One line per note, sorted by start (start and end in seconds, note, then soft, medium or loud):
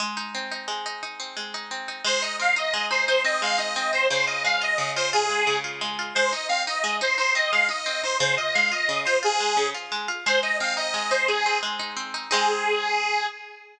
0.00 0.67 G#3 medium
0.17 0.51 D#4 medium
0.35 1.19 C4 medium
0.51 0.85 D#4 medium
0.68 1.36 G#3 medium
0.86 1.02 D#4 medium
1.03 1.54 D#4 medium
1.20 1.71 C4 medium
1.37 2.02 G#3 medium
1.54 1.88 D#4 medium
1.71 2.03 C4 medium
1.88 2.04 D#4 medium
2.04 2.73 G#3 medium
2.04 2.22 C5 loud
2.22 2.56 D#4 medium
2.22 2.36 D#5 medium
2.39 3.24 C4 medium
2.39 2.55 F5 loud
2.56 2.90 D#4 medium
2.56 2.86 D#5 medium
2.74 3.41 G#3 loud
2.91 3.08 D#4 medium
2.91 3.05 C5 loud
3.07 3.58 D#4 medium
3.07 3.22 C5 loud
3.24 3.75 C4 medium
3.24 3.41 D#5 loud
3.42 4.07 G#3 medium
3.42 3.58 F5 loud
3.58 3.92 D#4 medium
3.58 3.91 D#5 medium
3.76 4.08 C4 medium
3.93 4.09 D#4 medium
3.93 4.07 C5 loud
4.10 4.78 C#3 loud
4.10 4.25 C5 loud
4.26 4.61 F4 medium
4.26 4.43 D#5 loud
4.44 5.29 G#3 medium
4.44 4.61 F5 loud
4.61 4.96 F4 medium
4.61 4.91 D#5 loud
4.78 5.46 C#3 medium
4.96 5.13 F4 medium
4.96 5.10 C5 loud
5.13 5.64 F4 medium
5.13 5.57 G#4 loud
5.30 5.81 G#3 medium
5.47 6.12 C#3 medium
5.64 5.98 F4 medium
5.81 6.14 G#3 medium
5.99 6.15 F4 medium
6.15 6.33 G#3 medium
6.15 6.31 C5 loud
6.32 6.50 D#4 medium
6.32 6.47 D#5 medium
6.48 6.67 C4 medium
6.48 6.63 F5 loud
6.67 6.84 D#4 medium
6.67 6.96 D#5 medium
6.84 7.01 G#3 loud
7.01 7.17 D#4 medium
7.01 7.15 C5 loud
7.18 7.35 D#4 medium
7.18 7.33 C5 loud
7.35 7.52 C4 medium
7.35 7.52 D#5 loud
7.51 7.70 G#3 medium
7.51 7.67 F5 loud
7.69 7.86 D#4 medium
7.69 8.02 D#5 medium
7.86 8.03 C4 medium
8.03 8.20 D#4 medium
8.03 8.17 C5 loud
8.20 8.37 C#3 loud
8.20 8.34 C5 loud
8.37 8.55 F4 medium
8.37 8.53 D#5 loud
8.54 8.72 G#3 medium
8.54 8.70 F5 loud
8.72 8.89 F4 medium
8.72 9.00 D#5 loud
8.89 9.06 C#3 medium
9.05 9.22 F4 medium
9.05 9.18 C5 loud
9.23 9.40 F4 medium
9.23 9.68 G#4 loud
9.40 9.57 G#3 medium
9.57 9.74 C#3 medium
9.75 9.92 F4 medium
9.92 10.09 G#3 medium
10.08 10.25 F4 medium
10.26 10.93 G#3 loud
10.26 10.40 C5 loud
10.43 10.76 D#4 medium
10.43 10.57 D#5 loud
10.60 11.45 C4 medium
10.60 10.75 F5 loud
10.77 11.10 D#4 medium
10.77 11.10 D#5 loud
10.94 11.62 G#3 medium
11.11 11.28 D#4 medium
11.11 11.27 C5 loud
11.27 11.79 D#4 medium
11.27 11.59 G#4 loud
11.46 11.96 C4 medium
11.63 12.28 G#3 medium
11.79 12.14 D#4 medium
11.97 12.29 C4 medium
12.14 12.30 D#4 medium
12.31 13.26 G#3 loud
12.31 13.26 C4 medium
12.31 13.26 D#4 loud
12.31 13.26 G#4 loud